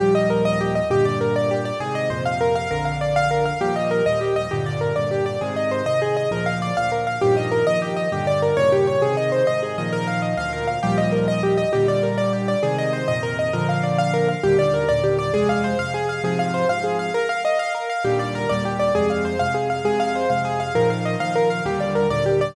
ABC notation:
X:1
M:6/8
L:1/8
Q:3/8=133
K:Eb
V:1 name="Acoustic Grand Piano"
G e B e G e | G d B d G d | A e c f B f | B f d f B f |
G e B e G e | G d B d G d | A e c e A e | B f d f B f |
G e B e G e | G d B _d G d | A e c e A e | B f e f B f |
G e B e G e | G d B d G d | A e c e B e | B f d f B f |
G d B d G d | A f c f A f | A f c f A f | B f e f B f |
G d B d G d | A f c f A f | A f c f A f | B f e f B f |
G d B d G d |]
V:2 name="Acoustic Grand Piano" clef=bass
[E,,B,,F,G,]6 | [G,,B,,D,]6 | [A,,C,E,]2 [F,,B,,C,]4 | [B,,,F,,D,]6 |
[E,,B,,F,G,]3 [E,,B,,F,G,]3 | [G,,B,,D,]3 [G,,B,,D,]3 | [A,,C,E,]3 [A,,C,E,]3 | [D,,B,,F,]3 [D,,B,,F,]3 |
[G,,B,,E,F,]3 [G,,B,,E,F,]3 | [G,,B,,D,]3 [E,,G,,B,,_D,]3 | [A,,C,E,]3 [A,,C,E,]2 [B,,E,F,]- | [B,,E,F,]3 [D,,B,,F,]3 |
[E,,B,,F,G,]6 | [B,,D,G,]6 | [A,,C,E,]3 [F,,B,,C,E,]3 | [B,,D,F,]6 |
[E,,B,,D,G,]3 [E,,B,,D,G,]3 | [F,,C,A,]3 [F,,C,A,]3 | [A,,C,F,]3 [A,,C,F,]3 | z6 |
[E,,B,,D,G,]3 [E,,B,,D,G,]3 | [F,,C,A,]3 [F,,C,A,]3 | [F,,C,A,]3 [F,,C,A,]3 | [B,,E,F,]3 [B,,E,F,]3 |
[E,,B,,D,G,]3 [E,,B,,D,G,]3 |]